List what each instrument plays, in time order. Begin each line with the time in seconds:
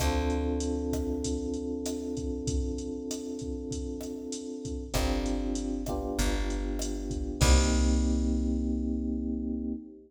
0.00 electric bass (finger) D2, electric piano 1 C4 D4 F4 A4, kick, cross-stick, closed hi-hat
0.30 closed hi-hat
0.60 closed hi-hat
0.93 kick, cross-stick, closed hi-hat
1.24 kick, closed hi-hat
1.54 closed hi-hat
1.86 cross-stick, closed hi-hat
2.17 kick, closed hi-hat
2.47 kick, closed hi-hat
2.78 closed hi-hat
3.11 cross-stick, closed hi-hat
3.39 kick, closed hi-hat
3.71 kick, closed hi-hat
4.01 cross-stick, closed hi-hat
4.32 closed hi-hat
4.65 kick, closed hi-hat
4.94 electric bass (finger) G1, electric piano 1 C4 D4 F4 G4, kick, cross-stick, closed hi-hat
5.26 closed hi-hat
5.55 closed hi-hat
5.86 electric piano 1 B3 D4 F4 G4, kick, cross-stick, closed hi-hat
6.19 electric bass (finger) G1, kick, closed hi-hat
6.50 closed hi-hat
6.79 cross-stick, closed hi-hat
7.10 kick, closed hi-hat
7.41 electric bass (finger) C2, electric piano 1 A#3 C4 D#4 G4, kick, crash